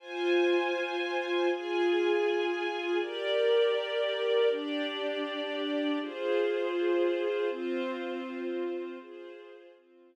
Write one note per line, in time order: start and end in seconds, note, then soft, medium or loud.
0.00 1.49 F4 loud
0.00 1.49 C5 medium
0.00 1.49 G#5 medium
1.50 2.99 F4 medium
1.50 2.99 G#4 medium
1.50 2.99 G#5 medium
3.00 4.49 G4 medium
3.00 4.49 A#4 medium
3.00 4.49 D5 loud
4.50 5.99 D4 medium
4.50 5.99 G4 medium
4.50 5.99 D5 medium
6.00 7.49 F4 medium
6.00 7.49 G#4 medium
6.00 7.49 C5 medium
7.50 8.99 C4 medium
7.50 8.99 F4 loud
7.50 8.99 C5 medium
9.00 9.74 F4 medium
9.00 9.74 G#4 loud
9.00 9.74 C5 medium
9.75 10.16 C4 medium
9.75 10.16 F4 medium
9.75 10.16 C5 medium